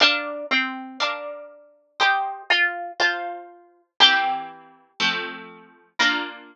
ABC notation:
X:1
M:2/2
L:1/8
Q:1/2=60
K:Bb
V:1 name="Harpsichord"
D2 C2 D4 | G2 F2 F4 | G6 z2 | B8 |]
V:2 name="Harpsichord"
[Bdf]4 [Bdf]4 | [ceg]4 [Fca]4 | [=E,B,CG]4 [F,A,C]4 | [B,DF]8 |]